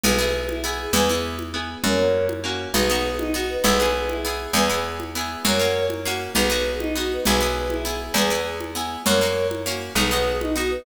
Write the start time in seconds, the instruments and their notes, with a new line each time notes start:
0.04 electric bass (finger) B1, pizzicato strings B3 E4 G#4, choir aahs G#4 B4, low conga
0.18 pizzicato strings B3 E4 G#4
0.49 choir aahs E4, high conga
0.63 pizzicato strings B3 E4 G#4, choir aahs G#4
0.81 choir aahs G#4
0.93 electric bass (finger) E2, pizzicato strings B3 E4 G#4, choir aahs G#4 B4, low conga
1.09 pizzicato strings B3 E4 G#4
1.39 high conga
1.54 pizzicato strings B3 E4 G#4
1.84 electric bass (finger) F#2, pizzicato strings A#3 C#4 F#4, choir aahs A#4 C#5, low conga
1.99 pizzicato strings A#3 C#4 F#4
2.29 high conga
2.44 pizzicato strings A#3 C#4 F#4
2.74 electric bass (finger) B1, pizzicato strings B3 D#4 F#4, choir aahs G#4 B4, low conga
2.90 pizzicato strings B3 D#4 F#4
3.17 choir aahs D#4, high conga
3.33 pizzicato strings B3 D#4 F#4, choir aahs F#4
3.49 choir aahs B4
3.64 electric bass (finger) B1, pizzicato strings B3 E4 G#4, choir aahs G#4 B4, low conga
3.80 pizzicato strings B3 E4 G#4
4.09 choir aahs E4, high conga
4.23 pizzicato strings B3 E4 G#4, choir aahs G#4
4.41 choir aahs G#4
4.53 electric bass (finger) E2, pizzicato strings B3 E4 G#4, choir aahs G#4 B4, low conga
4.69 pizzicato strings B3 E4 G#4
5.00 high conga
5.15 pizzicato strings B3 E4 G#4
5.44 electric bass (finger) F#2, pizzicato strings A#3 C#4 F#4, choir aahs A#4 C#5, low conga
5.59 pizzicato strings A#3 C#4 F#4
5.90 high conga
6.05 pizzicato strings A#3 C#4 F#4
6.35 electric bass (finger) B1, pizzicato strings B3 D#4 F#4, choir aahs G#4 B4, low conga
6.50 pizzicato strings B3 D#4 F#4
6.79 choir aahs D#4, high conga
6.95 pizzicato strings B3 D#4 F#4, choir aahs F#4
7.13 choir aahs B4
7.25 electric bass (finger) B1, pizzicato strings B3 E4 G#4, choir aahs G#4 B4, low conga
7.41 pizzicato strings B3 E4 G#4
7.70 choir aahs E4, high conga
7.85 pizzicato strings B3 E4 G#4, choir aahs G#4
8.00 choir aahs G#4
8.14 electric bass (finger) E2, pizzicato strings B3 E4 G#4, choir aahs G#4 B4, low conga
8.30 pizzicato strings B3 E4 G#4
8.61 high conga
8.75 pizzicato strings B3 E4 G#4
9.06 electric bass (finger) F#2, pizzicato strings A#3 C#4 F#4, choir aahs A#4 C#5, low conga
9.21 pizzicato strings A#3 C#4 F#4
9.51 high conga
9.66 pizzicato strings A#3 C#4 F#4
9.95 electric bass (finger) B1, pizzicato strings B3 D#4 F#4, choir aahs G#4 B4, low conga
10.11 pizzicato strings B3 D#4 F#4
10.41 choir aahs D#4, high conga
10.55 pizzicato strings B3 D#4 F#4, choir aahs F#4
10.71 choir aahs B4